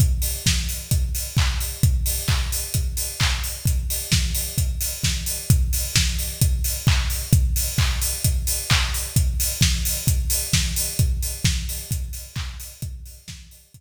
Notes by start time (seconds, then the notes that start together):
0.00 kick, closed hi-hat
0.22 open hi-hat
0.46 kick, snare
0.69 open hi-hat
0.91 kick, closed hi-hat
1.15 open hi-hat
1.37 kick, clap
1.60 open hi-hat
1.83 kick, closed hi-hat
2.06 open hi-hat
2.28 kick, clap
2.52 open hi-hat
2.74 kick, closed hi-hat
2.97 open hi-hat
3.20 kick, clap
3.44 open hi-hat
3.65 kick, closed hi-hat
3.90 open hi-hat
4.12 kick, snare
4.35 open hi-hat
4.58 kick, closed hi-hat
4.81 open hi-hat
5.03 kick, snare
5.26 open hi-hat
5.50 kick, closed hi-hat
5.73 open hi-hat
5.96 kick, snare
6.19 open hi-hat
6.41 kick, closed hi-hat
6.64 open hi-hat
6.87 kick, clap
7.10 open hi-hat
7.33 kick, closed hi-hat
7.56 open hi-hat
7.78 kick, clap
8.02 open hi-hat
8.24 kick, closed hi-hat
8.47 open hi-hat
8.70 kick, clap
8.94 open hi-hat
9.16 kick, closed hi-hat
9.40 open hi-hat
9.61 kick, snare
9.85 open hi-hat
10.07 kick, closed hi-hat
10.30 open hi-hat
10.53 kick, snare
10.76 open hi-hat
10.99 kick, closed hi-hat
11.23 open hi-hat
11.44 kick, snare
11.69 open hi-hat
11.91 kick, closed hi-hat
12.13 open hi-hat
12.36 kick, clap
12.60 open hi-hat
12.82 kick, closed hi-hat
13.06 open hi-hat
13.28 kick, snare
13.51 open hi-hat
13.74 kick, closed hi-hat